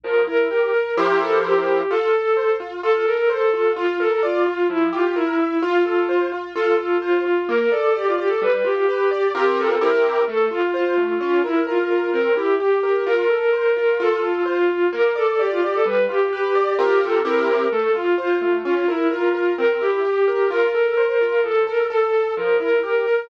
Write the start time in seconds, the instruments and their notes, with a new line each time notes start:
0.03 acoustic grand piano F3, violin A#4
0.27 acoustic grand piano E4, violin A#4
0.51 acoustic grand piano G4, violin A#4
0.74 acoustic grand piano A#4
0.97 acoustic grand piano F3 E4 G4 A#4 C5, violin G4
1.21 violin A4
1.44 violin G4
1.90 acoustic grand piano F4, violin A4
2.13 acoustic grand piano A4
2.37 acoustic grand piano C5
2.60 acoustic grand piano F4
2.83 acoustic grand piano F4, violin A4
3.06 acoustic grand piano A4, violin A#4
3.29 violin A4, acoustic grand piano C5
3.53 acoustic grand piano F4
3.76 violin F4, acoustic grand piano F4
4.00 violin A4, acoustic grand piano A#4
4.23 violin F4, acoustic grand piano D5
4.46 acoustic grand piano F4
4.68 acoustic grand piano F3, violin E4
4.93 violin F4, acoustic grand piano G4
5.15 violin E4, acoustic grand piano A#4
5.40 acoustic grand piano E5
5.62 violin F4, acoustic grand piano F4
5.85 acoustic grand piano A4
6.09 acoustic grand piano C5
6.32 acoustic grand piano F4
6.55 acoustic grand piano F4, violin A4
6.78 violin F4, acoustic grand piano A4
7.02 violin F4, acoustic grand piano C5
7.25 acoustic grand piano F4
7.49 acoustic grand piano A#3, violin A#4
7.71 violin A4, acoustic grand piano D5
7.95 violin G4, acoustic grand piano D5
8.07 violin F4
8.18 violin G4, acoustic grand piano D5
8.29 violin A4
8.42 acoustic grand piano G3, violin B4
8.64 acoustic grand piano F4, violin G4
8.87 violin G4, acoustic grand piano B4
9.11 acoustic grand piano D5
9.34 acoustic grand piano C4 F4 G4 A#4, violin G4
9.59 violin A4
9.80 acoustic grand piano C4 E4 G4 A#4, violin A#4
10.28 acoustic grand piano A3, violin A4
10.51 acoustic grand piano F4, violin F4
10.74 violin F4, acoustic grand piano C5
10.97 acoustic grand piano A3
11.21 acoustic grand piano C#4, violin F4
11.44 violin E4, acoustic grand piano A#4
11.67 violin F4, acoustic grand piano A#4
11.90 acoustic grand piano A#4
12.13 acoustic grand piano C4, violin A#4
12.35 acoustic grand piano E4, violin G4
12.59 violin G4, acoustic grand piano G4
12.83 acoustic grand piano A#4
13.06 acoustic grand piano F4, violin A#4
13.30 acoustic grand piano A4
13.53 acoustic grand piano C5
13.77 acoustic grand piano F4
14.00 acoustic grand piano F4, violin A4
14.22 violin F4, acoustic grand piano A4
14.46 violin F4, acoustic grand piano C5
14.70 acoustic grand piano F4
14.93 acoustic grand piano A#3, violin A#4
15.16 violin A4, acoustic grand piano D5
15.39 violin G4, acoustic grand piano D5
15.50 violin F4
15.62 violin G4, acoustic grand piano D5
15.75 violin A4
15.85 acoustic grand piano G3, violin B4
16.09 acoustic grand piano F4, violin G4
16.33 violin G4, acoustic grand piano B4
16.55 acoustic grand piano D5
16.79 acoustic grand piano C4 F4 G4 A#4, violin G4
17.03 violin A4
17.24 acoustic grand piano C4 E4 G4 A#4, violin A#4
17.71 acoustic grand piano A3, violin A4
17.95 acoustic grand piano F4, violin F4
18.18 violin F4, acoustic grand piano C5
18.41 acoustic grand piano A3
18.65 acoustic grand piano C#4, violin F4
18.88 violin E4, acoustic grand piano A#4
19.11 violin F4, acoustic grand piano A#4
19.34 acoustic grand piano A#4
19.58 acoustic grand piano C4, violin A#4
19.80 acoustic grand piano E4, violin G4
20.04 violin G4, acoustic grand piano G4
20.28 acoustic grand piano A#4
20.50 acoustic grand piano F4, violin A#4
20.74 acoustic grand piano A4
20.97 acoustic grand piano C5
21.21 acoustic grand piano F4
21.44 acoustic grand piano F3, violin A4
21.67 acoustic grand piano A4, violin A#4
21.89 violin A4, acoustic grand piano A4
22.13 acoustic grand piano A4
22.37 acoustic grand piano F3, violin A#4
22.60 acoustic grand piano E4, violin A#4
22.83 acoustic grand piano G4, violin A#4
23.07 acoustic grand piano A#4